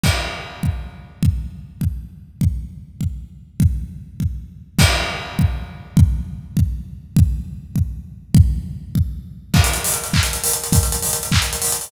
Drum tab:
CC |x-----------|------------|------------|------------|
HH |------------|------------|------------|------------|
CP |------------|------------|------------|------------|
BD |o-----o-----|o-----o-----|o-----o-----|o-----o-----|

CC |x-----------|------------|------------|------------|
HH |------------|------------|------------|------------|
CP |------------|------------|------------|------------|
BD |o-----o-----|o-----o-----|o-----o-----|o-----o-----|

CC |x-----------|------------|
HH |-xxoxx-xxoxx|xxxoxx-xxoxo|
CP |------x-----|------x-----|
BD |o-----o-----|o-----o-----|